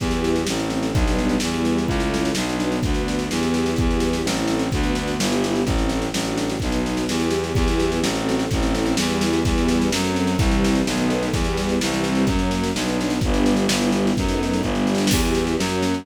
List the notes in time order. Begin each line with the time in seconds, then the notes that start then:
0.00 E2 B3 E4 G4, kick, snare
0.11 snare
0.24 snare
0.36 snare
0.47 A1 A3 C4 E4, snare
0.59 snare
0.70 snare
0.83 snare
0.93 B1 G3 B3 D4, kick, snare
1.07 snare
1.19 snare
1.29 snare
1.40 E2 G3 B3 E4, snare
1.54 snare
1.65 snare
1.78 snare
1.87 C#2 A3 C#4 E4, kick, snare
2.00 snare
2.14 snare
2.25 snare
2.35 B1 B3 D4 F#4, snare
2.49 snare
2.60 snare
2.72 snare
2.83 D2 B3 D4 F#4, kick, snare
2.94 snare
3.08 snare
3.19 snare
3.30 E2 B3 E4 G4, snare
3.43 snare
3.54 snare
3.66 snare
3.76 E2 B3 E4 G4, kick, snare
3.91 snare
4.00 snare
4.13 snare
4.24 A1 A3 C4 E4, snare
4.37 snare
4.48 snare
4.59 snare
4.72 D2 B3 D4 F#4, kick, snare
4.83 snare
4.95 snare
5.08 snare
5.19 G1 B3 E4 G4, snare
5.32 snare
5.44 snare
5.56 snare
5.65 A1 A3 C4 E4, kick, snare
5.78 snare
5.89 snare
6.02 snare
6.13 A1 A3 D4 F#4, snare
6.25 snare
6.38 snare
6.49 snare
6.60 B1 B3 D#4 F#4, kick, snare
6.72 snare
6.86 snare
6.97 snare
7.09 E2 B3 E4 G4, snare
7.20 snare
7.31 snare
7.44 snare
7.55 E2 B3 E4 G4, kick, snare
7.68 snare
7.80 snare
7.92 snare
8.01 A1 A3 C4 F#4, snare
8.16 snare
8.29 snare
8.39 snare
8.50 A1 A3 C4 E4, kick, snare
8.63 snare
8.75 snare
8.86 snare
8.97 E2 G3 B3 E4, snare
9.10 snare
9.21 snare
9.33 snare
9.45 E2 G3 B3 E4, kick, snare
9.58 snare
9.68 snare
9.81 snare
9.92 F#2 F#3 A3 C4, snare
10.04 snare
10.16 snare
10.27 snare
10.38 C2 E3 G3 C4, kick, snare
10.51 snare
10.64 snare
10.75 snare
10.86 B1 D#3 F#3 A3 B3, snare
10.97 snare
11.10 snare
11.23 snare
11.33 E2 E3 G3 B3, kick, snare
11.44 snare
11.57 snare
11.69 snare
11.80 C2 E3 G3 C4, snare
11.94 snare
12.04 snare
12.15 snare
12.27 F#2 F#3 A#3 C#4, kick, snare
12.39 snare
12.51 snare
12.63 snare
12.75 B1 F#3 B3 D4, snare
12.88 snare
13.01 snare
13.10 snare
13.21 G1 G3 B3 D4, kick, snare
13.34 snare
13.46 snare
13.56 snare
13.68 G1 G3 B3 E4, snare
13.81 snare
13.92 snare
14.07 snare
14.17 F#2 F#3 A3 B3 D#4, kick, snare
14.28 snare
14.43 snare
14.53 snare
14.63 G1 G3 B3 D4, kick, snare
14.75 snare
14.87 snare
14.95 snare
14.98 snare
15.07 snare
15.11 E2 B3 E4 G4, kick, snare, crash
15.25 snare
15.35 snare
15.47 snare
15.59 F#2 A#3 C#4 F#4, snare
15.69 snare
15.82 snare
15.94 snare